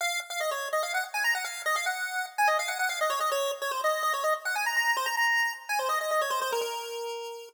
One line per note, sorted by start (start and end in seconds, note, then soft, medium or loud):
0.01 0.20 F5 loud
0.30 0.40 F5 medium
0.40 0.50 D#5 medium
0.51 0.68 C#5 medium
0.73 0.82 D#5 medium
0.83 0.93 F5 medium
0.94 1.04 F#5 medium
1.14 1.24 G#5 medium
1.24 1.34 A#5 medium
1.35 1.45 F#5 medium
1.44 1.62 F5 medium
1.66 1.76 D#5 loud
1.76 1.86 F5 medium
1.86 2.26 F#5 medium
2.38 2.48 G#5 medium
2.47 2.57 D#5 medium
2.59 2.69 F5 medium
2.68 2.78 F#5 medium
2.79 2.89 F#5 medium
2.89 2.99 F5 medium
3.01 3.11 D#5 medium
3.10 3.20 C#5 medium
3.20 3.30 D#5 medium
3.32 3.51 C#5 loud
3.62 3.71 C#5 medium
3.71 3.81 C5 medium
3.84 4.02 D#5 medium
4.03 4.13 D#5 medium
4.13 4.23 C#5 medium
4.24 4.34 D#5 medium
4.45 4.55 F#5 medium
4.55 4.65 G#5 medium
4.66 4.76 A#5 medium
4.76 4.96 A#5 medium
4.97 5.07 C5 loud
5.06 5.16 A#5 medium
5.17 5.53 A#5 medium
5.69 5.79 G#5 medium
5.79 5.89 C5 medium
5.89 5.99 D#5 medium
6.01 6.10 D#5 medium
6.11 6.21 D#5 medium
6.21 6.31 C#5 medium
6.30 6.40 C5 loud
6.42 6.51 C5 loud
6.52 6.61 A#4 medium
6.61 7.49 A#4 medium